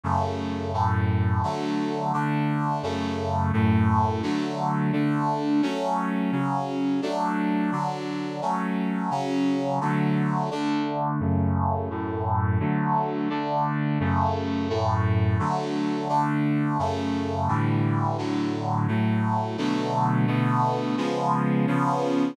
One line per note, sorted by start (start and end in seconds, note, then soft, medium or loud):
0.03 0.73 F#2 medium
0.03 0.73 C#3 medium
0.03 0.73 A3 medium
0.73 1.42 F#2 medium
0.73 1.42 A2 medium
0.73 1.42 A3 medium
1.43 2.12 D3 medium
1.43 2.12 F#3 medium
1.43 2.12 A3 medium
2.13 2.82 D3 medium
2.13 2.82 A3 medium
2.13 2.82 D4 medium
2.83 3.52 F#2 medium
2.83 3.52 C#3 medium
2.83 3.52 A3 medium
3.53 4.22 F#2 medium
3.53 4.22 A2 medium
3.53 4.22 A3 medium
4.22 4.92 D3 medium
4.22 4.92 F#3 medium
4.22 4.92 A3 medium
4.92 5.61 D3 medium
4.92 5.61 A3 medium
4.92 5.61 D4 medium
5.62 6.31 F#3 medium
5.62 6.31 A3 medium
5.62 6.31 C#4 medium
6.32 7.01 C#3 medium
6.32 7.01 F#3 medium
6.32 7.01 C#4 medium
7.02 7.71 F#3 medium
7.02 7.71 A3 medium
7.02 7.71 D4 medium
7.72 8.41 D3 medium
7.72 8.41 F#3 medium
7.72 8.41 D4 medium
8.41 9.10 F#3 medium
8.41 9.10 A3 medium
8.41 9.10 C#4 medium
9.10 9.79 C#3 medium
9.10 9.79 F#3 medium
9.10 9.79 C#4 medium
9.81 10.50 D3 medium
9.81 10.50 F#3 medium
9.81 10.50 A3 medium
10.51 11.20 D3 medium
10.51 11.19 A3 medium
10.51 11.20 D4 medium
11.20 11.89 F#2 medium
11.20 11.89 C#3 medium
11.20 11.89 A3 medium
11.90 12.59 F#2 medium
11.90 12.59 A2 medium
11.90 12.59 A3 medium
12.60 13.29 D3 medium
12.60 13.29 F#3 medium
12.60 13.29 A3 medium
13.30 13.99 D3 medium
13.30 13.99 A3 medium
13.30 13.99 D4 medium
14.00 14.69 F#2 medium
14.00 14.69 C#3 medium
14.00 14.69 A3 medium
14.69 15.38 F#2 medium
14.69 15.38 A2 medium
14.69 15.38 A3 medium
15.39 16.08 D3 medium
15.39 16.08 F#3 medium
15.39 16.08 A3 medium
16.09 16.78 D3 medium
16.09 16.78 A3 medium
16.09 16.78 D4 medium
16.79 17.48 F#2 medium
16.79 17.48 C#3 medium
16.79 17.48 A3 medium
17.48 18.17 A2 medium
17.48 18.17 D3 medium
17.48 18.17 E3 medium
17.48 18.17 G3 medium
18.18 18.87 A2 medium
18.18 18.87 D3 medium
18.18 18.87 F#3 medium
18.88 19.57 A2 medium
18.88 19.57 F#3 medium
18.88 19.57 A3 medium
19.58 20.26 B2 medium
19.58 20.26 D3 medium
19.58 20.27 F#3 medium
19.58 20.26 A3 medium
20.27 20.96 B2 medium
20.27 20.96 D3 medium
20.27 20.96 A3 medium
20.27 20.96 B3 medium
20.97 21.66 C#3 medium
20.97 21.66 F3 medium
20.97 21.66 G#3 medium
20.97 21.66 B3 medium
21.67 22.36 C#3 medium
21.67 22.36 F3 medium
21.67 22.36 B3 medium
21.67 22.36 C#4 medium